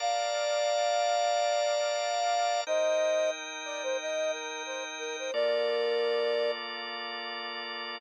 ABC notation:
X:1
M:4/4
L:1/16
Q:"Swing 16ths" 1/4=90
K:Bb
V:1 name="Flute"
[df]16 | [ce]4 z2 d c e2 B2 c z B c | [Bd]8 z8 |]
V:2 name="Drawbar Organ"
[Bdfa]16 | [EBg]16 | [B,FAd]16 |]